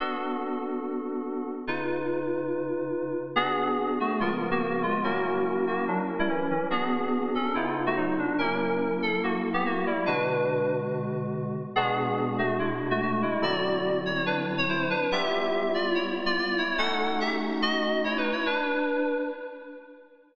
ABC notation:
X:1
M:4/4
L:1/16
Q:1/4=143
K:Bm
V:1 name="Electric Piano 2"
z16 | z16 | [B,^G]6 [A,F]2 [^G,^E] z2 [^A,F] [A,F]2 [G,E]2 | [^A,F]6 [A,F]2 [F,D] z2 [G,E] [E,C]2 [E,C]2 |
[B,^G]6 [CA]2 E z2 [A,F] [F,^D]2 =D2 | [C^A]6 =A2 [^A,F] z2 [B,G] [A,F]2 [G,E]2 | [DB]8 z8 | [B,^G]6 [A,F]2 [^G,E] z2 [A,F] [A,F]2 [G,E]2 |
[Fd]6 c2 [DB] z2 _d [E=c]2 [=DB]2 | [Ge]6 [=Fd]2 [Ec] z2 [Fd] [Fd]2 [Ec]2 | [Af]4 [Ge] z3 [F^d]4 (3[Ec]2 [^DB]2 [Ec]2 | [DB]8 z8 |]
V:2 name="Electric Piano 2"
[B,DFA]16 | [C,^D^EB]16 | [B,DF^G]8 [C,^E,B,^A]8 | [F,CE^A]16 |
[B,DF^G]8 [C,B,^D^E]8 | [F,^A,E]16 | [B,,D,^G,F]16 | [B,,^G,DF]16 |
[D,F,=CE]16 | [G,B,E=F]16 | [A,C^DF]16 | z16 |]